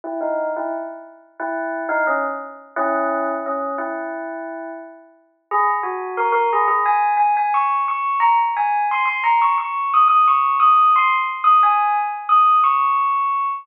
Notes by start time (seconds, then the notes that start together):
0.04 E4
0.21 D#4
0.57 E4
1.40 E4
1.89 D#4
2.07 C#4
2.76 C#4 E4
3.46 C#4
3.78 E4
5.51 G#4
5.83 F#4
6.17 A#4
6.32 A#4
6.53 G#4
6.68 G#4
6.86 G#5
7.17 G#5
7.37 G#5
7.54 C#6
7.88 C#6
8.20 A#5
8.57 G#5
8.91 C6
9.06 C6
9.24 A#5
9.42 C#6
9.58 C#6
9.94 D#6
10.08 D#6
10.28 C#6
10.60 D#6
10.96 C6
11.44 D#6
11.63 G#5
12.29 D#6
12.64 C#6